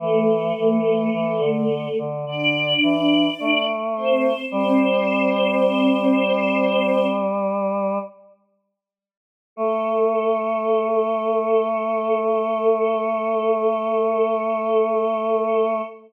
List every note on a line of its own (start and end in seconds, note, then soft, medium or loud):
0.00 0.52 E3 loud
0.00 1.96 A3 loud
0.00 1.96 A4 loud
0.58 1.09 E3 medium
1.13 1.40 E3 medium
1.39 1.88 D3 medium
1.99 2.25 D3 medium
2.26 2.74 D3 medium
2.26 3.65 D4 medium
2.26 3.65 D5 medium
2.83 3.29 E3 medium
3.40 4.33 A3 medium
3.96 4.46 C4 medium
3.96 4.46 C5 medium
4.51 7.99 G3 loud
4.51 7.06 C4 medium
4.51 7.06 C5 loud
9.56 15.82 A3 loud
9.56 15.81 A4 loud